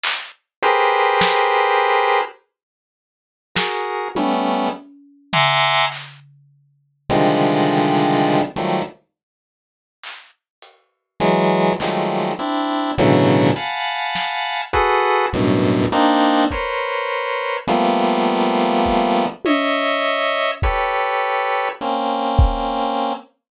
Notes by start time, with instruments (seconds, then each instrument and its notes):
0.03 clap
0.63 lead 1 (square) G4 G#4 A#4 B4 C5
1.21 snare
3.55 lead 1 (square) F#4 G#4 A#4, snare
4.15 lead 1 (square) G3 A3 B3 C#4, high tom
5.33 lead 1 (square) E5 F#5 G#5 A#5 C6 D6, floor tom
5.92 clap
7.09 lead 1 (square) C3 D3 D#3 F3 G3 G#3
8.27 cowbell
8.56 lead 1 (square) D#3 F3 F#3 G3 A3
10.03 clap
10.62 closed hi-hat
11.20 lead 1 (square) E3 F#3 G#3, snare
11.80 lead 1 (square) D#3 F3 F#3 G3 G#3 A3, clap
12.39 lead 1 (square) C4 D4 E4
12.98 lead 1 (square) A2 B2 C#3 D3 E3 F#3
13.56 lead 1 (square) F5 F#5 G#5 A5 B5
14.15 snare
14.73 lead 1 (square) F#4 G#4 A4 B4, kick
15.33 lead 1 (square) F#2 G2 A2 B2
15.92 lead 1 (square) A#3 C4 D4 D#4
16.50 lead 1 (square) A#4 B4 C5 C#5, kick
17.67 lead 1 (square) F3 G3 A3 A#3 B3, cowbell
18.86 kick
19.45 lead 1 (square) C#5 D#5 E5, high tom
20.62 lead 1 (square) G4 A4 B4 C#5, kick
21.81 lead 1 (square) A#3 C4 C#4
22.39 kick